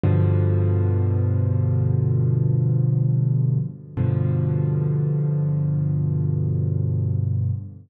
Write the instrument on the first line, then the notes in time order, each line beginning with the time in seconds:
acoustic grand piano
0.03 G2 B2 D3 F3
3.97 G2 B2 D3 F3